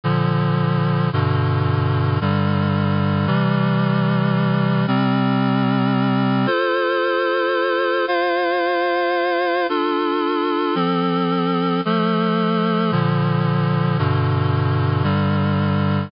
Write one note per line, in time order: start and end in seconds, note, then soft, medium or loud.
0.04 1.10 A#2 medium
0.04 1.10 D3 loud
0.04 1.10 F3 medium
1.13 2.19 G2 loud
1.13 2.19 B2 loud
1.13 2.19 D3 medium
2.21 3.27 G2 medium
2.21 3.27 D3 medium
2.21 3.26 G3 medium
3.27 4.86 C3 medium
3.27 4.86 E3 medium
3.27 4.86 G3 loud
4.87 6.46 C3 medium
4.87 6.46 G3 loud
4.87 6.46 C4 loud
6.46 8.05 F4 medium
6.46 8.05 A4 medium
6.46 8.05 C5 loud
8.07 9.67 F4 medium
8.07 9.67 C5 medium
8.07 9.67 F5 medium
9.69 10.75 D4 medium
9.69 10.75 F4 medium
9.69 10.74 A4 medium
10.75 11.81 F3 medium
10.75 11.81 C4 medium
10.75 11.81 A4 medium
11.85 12.91 F3 medium
11.85 12.91 A3 medium
11.85 12.91 A4 medium
12.91 13.97 A#2 medium
12.91 13.97 D3 loud
12.91 13.97 F3 medium
13.98 15.03 G2 loud
13.98 15.04 B2 loud
13.98 15.03 D3 medium
15.03 16.09 G2 medium
15.03 16.09 D3 medium
15.03 16.09 G3 medium